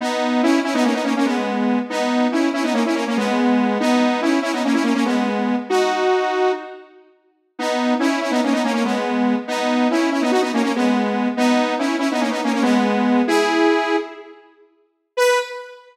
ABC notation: X:1
M:9/8
L:1/16
Q:3/8=95
K:B
V:1 name="Lead 2 (sawtooth)"
[B,D]4 [CE]2 [CE] [B,D] [A,C] [B,D] [A,C] [A,C] [G,B,]6 | [B,D]4 [CE]2 [CE] [B,D] [A,C] [CE] [A,C] [A,C] [G,B,]6 | [B,D]4 [CE]2 [CE] [B,D] [A,C] [CE] [A,C] [A,C] [G,B,]6 | [DF]8 z10 |
[B,D]4 [CE]2 [CE] [B,D] [A,C] [B,D] [A,C] [A,C] [G,B,]6 | [B,D]4 [CE]2 [CE] [B,D] [DF] [B,D] [A,C] [A,C] [G,B,]6 | [B,D]4 [CE]2 [CE] [B,D] [A,C] [B,D] [A,C] [A,C] [G,B,]6 | [EG]8 z10 |
B6 z12 |]